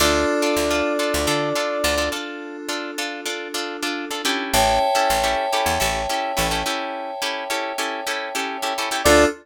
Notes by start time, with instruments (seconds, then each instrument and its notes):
0.00 electric bass (finger) D2, electric piano 2 D4 F4 A4, acoustic guitar (steel) D4 F4 A4, brass section D5
0.42 acoustic guitar (steel) D4 F4 A4
0.57 electric bass (finger) D2
0.70 acoustic guitar (steel) D4 F4 A4
0.99 acoustic guitar (steel) D4 F4 A4
1.14 electric bass (finger) D2
1.27 electric bass (finger) D3, acoustic guitar (steel) D4 F4 A4
1.55 acoustic guitar (steel) D4 F4 A4
1.84 electric bass (finger) D2, acoustic guitar (steel) D4 F4 A4
1.98 acoustic guitar (steel) D4 F4 A4
2.12 acoustic guitar (steel) D4 F4 A4
2.69 acoustic guitar (steel) D4 F4 A4
2.98 acoustic guitar (steel) D4 F4 A4
3.25 acoustic guitar (steel) D4 F4 A4
3.54 acoustic guitar (steel) D4 F4 A4
3.83 acoustic guitar (steel) D4 F4 A4
4.11 acoustic guitar (steel) D4 F4 A4
4.25 acoustic guitar (steel) C#4 E4 G4 A4
4.53 electric bass (finger) A1, electric piano 2 C#5 E5 G5 A5
4.95 acoustic guitar (steel) C#4 E4 G4 A4
5.10 electric bass (finger) A1
5.23 acoustic guitar (steel) C#4 E4 G4 A4
5.52 acoustic guitar (steel) C#4 E4 G4 A4
5.66 electric bass (finger) E2
5.80 electric bass (finger) A1, acoustic guitar (steel) C#4 E4 G4 A4
6.09 acoustic guitar (steel) C#4 E4 G4 A4
6.37 electric bass (finger) A1, acoustic guitar (steel) C#4 E4 G4 A4
6.51 acoustic guitar (steel) C#4 E4 G4 A4
6.66 acoustic guitar (steel) C#4 E4 G4 A4
7.22 acoustic guitar (steel) C#4 E4 G4 A4
7.50 acoustic guitar (steel) C#4 E4 G4 A4
7.78 acoustic guitar (steel) C#4 E4 G4 A4
8.07 acoustic guitar (steel) C#4 E4 G4 A4
8.35 acoustic guitar (steel) C#4 E4 G4 A4
8.62 acoustic guitar (steel) C#4 E4 G4 A4
8.78 acoustic guitar (steel) C#4 E4 G4 A4
8.91 acoustic guitar (steel) C#4 E4 G4 A4
9.04 electric bass (finger) D2, electric piano 2 D4 F4 A4, acoustic guitar (steel) D4 F4 A4, brass section D5